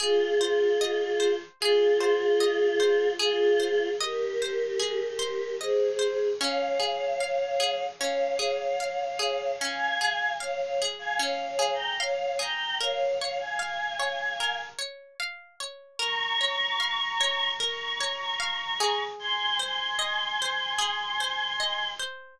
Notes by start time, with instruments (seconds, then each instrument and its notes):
0.00 choir aahs F4 G#4, pizzicato strings G#4
0.41 pizzicato strings C5
0.81 pizzicato strings D#5
1.20 pizzicato strings C5
1.60 choir aahs F4 G#4, pizzicato strings G#4
2.01 pizzicato strings C5
2.40 pizzicato strings D#5
2.80 pizzicato strings C5
3.19 choir aahs F4 G#4, pizzicato strings G#4
3.60 pizzicato strings C5
3.99 choir aahs G4 A#4, pizzicato strings D#5
4.42 pizzicato strings C5
4.79 pizzicato strings G#4
5.19 pizzicato strings C5
5.60 choir aahs G#4 C5, pizzicato strings D#5
5.99 pizzicato strings C5
6.40 pizzicato strings C#4, choir aahs C#5 F5
6.80 pizzicato strings G#4
7.20 pizzicato strings F5
7.60 pizzicato strings G#4
7.99 pizzicato strings C#4, choir aahs C#5 F5
8.39 pizzicato strings G#4
8.80 pizzicato strings F5
9.19 pizzicato strings G#4
9.59 pizzicato strings C#4, choir aahs F5 G#5
10.01 pizzicato strings G#4
10.40 choir aahs C#5 F5, pizzicato strings F5
10.61 choir aahs C#5 F5
10.82 pizzicato strings G#4
10.99 choir aahs F5 G#5
11.19 pizzicato strings C#4, choir aahs C#5 F5
11.46 choir aahs C#5 F5
11.59 pizzicato strings G#4
11.74 choir aahs G5 A#5
12.00 choir aahs C#5 F5, pizzicato strings F5
12.39 pizzicato strings G#4, choir aahs G5 A#5
12.81 pizzicato strings A#4, choir aahs C#5 F5
13.19 choir aahs C#5 F5, pizzicato strings C#5
13.39 choir aahs F5 G#5
13.59 pizzicato strings F5
14.00 pizzicato strings C#5
14.40 pizzicato strings A#4
14.79 pizzicato strings C#5
15.20 pizzicato strings F5
15.60 pizzicato strings C#5
15.99 pizzicato strings A#4, choir aahs A#5 C#6
16.41 pizzicato strings C#5
16.80 pizzicato strings F5
17.21 pizzicato strings C#5
17.60 pizzicato strings A#4, choir aahs A#5 C#6
18.01 pizzicato strings C#5
18.40 pizzicato strings F5
18.80 pizzicato strings G#4
19.19 choir aahs G#5 C6
19.59 pizzicato strings C5, choir aahs G#5 C6
19.99 pizzicato strings D#5
20.42 pizzicato strings C5
20.79 pizzicato strings G#4
21.20 pizzicato strings C5
21.60 pizzicato strings D#5
22.00 pizzicato strings C5